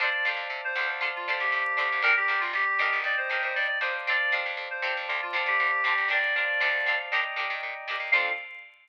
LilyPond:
<<
  \new Staff \with { instrumentName = "Clarinet" } { \time 4/4 \key f \mixolydian \tempo 4 = 118 d''8 r8. c''8 r8 f'16 r16 g'4~ g'16 | bes'16 g'8 f'16 g'4 d''16 c''8 c''16 d''16 d''16 c''16 r16 | d''8 r8. c''8 r8 f'16 r16 g'4~ g'16 | d''2 r2 |
f''4 r2. | }
  \new Staff \with { instrumentName = "Pizzicato Strings" } { \time 4/4 \key f \mixolydian <d' f' a' c''>8 <d' f' a' c''>4 <d' f' a' c''>8 <d' f' a' c''>8 <d' f' a' c''>4 <d' f' a' c''>8 | <d' g' bes'>8 <d' g' bes'>4 <d' ees' g' bes'>4 <d' ees' g' bes'>4 <d' ees' g' bes'>8 | <c' d' f' a'>8 <c' d' f' a'>4 <c' d' f' a'>4 <c' d' f' a'>4 <c' d' f' a'>8 | <d' g' bes'>8 <d' g' bes'>8 <c' d' f' a'>8 <c' d' f' a'>8 <d' ees' g' bes'>8 <d' ees' g' bes'>4 <d' ees' g' bes'>8 |
<d' f' a' c''>4 r2. | }
  \new Staff \with { instrumentName = "Electric Piano 1" } { \time 4/4 \key f \mixolydian <c'' d'' f'' a''>4. <c'' d'' f'' a''>2~ <c'' d'' f'' a''>8 | <d'' g'' bes''>2 <d'' ees'' g'' bes''>4. <c'' d'' f'' a''>8~ | <c'' d'' f'' a''>2 <c'' d'' f'' a''>4. <d'' g'' bes''>8~ | <d'' g'' bes''>8 <c'' d'' f'' a''>4. <d'' ees'' g'' bes''>2 |
<c' d' f' a'>4 r2. | }
  \new Staff \with { instrumentName = "Electric Bass (finger)" } { \clef bass \time 4/4 \key f \mixolydian f,8 f,16 f,16 c8 d,4 d,16 d,16 a,8 d,16 d,16 | g,,8 g,,16 g,,16 g,,8 g,,16 g,,16 ees,8 ees,16 bes,16 ees,8 f,8~ | f,8 f16 f,16 f,8 c16 f,16 d,8 d,16 d16 d,8 d,16 d,16 | g,,4 d,4 ees,8 bes,16 ees16 bes,8 bes,16 ees,16 |
f,4 r2. | }
>>